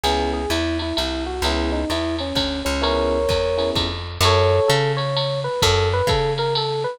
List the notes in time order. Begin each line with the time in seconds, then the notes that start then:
0.03 C#2 B3 C#4 E4 G#4, ride
0.33 G#4
0.50 E2 E4, hi-hat pedal, ride
0.79 E4, ride
0.97 C2 E4, ride
1.26 F#4
1.42 C#2 B3 C#4 E4 G#4, ride
1.72 D#4
1.90 E2 E4, hi-hat pedal, ride
2.19 C#4, ride
2.35 D2 C#4, kick, ride
2.65 C#2 C#4
2.82 B3 C#4 E4 G#4 A#4 C#5, ride
3.29 E2, kick, hi-hat pedal, ride
3.58 B3 C#4 E4 G#4, ride
3.75 F2, kick, ride
4.21 F#2, ride
4.25 A4 C#5
4.68 C#3 A4, hi-hat pedal, ride
4.97 C#5, ride
5.17 ride
5.44 B4
5.62 F#2 A4, kick, ride
5.93 B4
6.07 C#3 A4, kick, hi-hat pedal, ride
6.38 A#4, ride
6.55 A4, ride
6.84 B4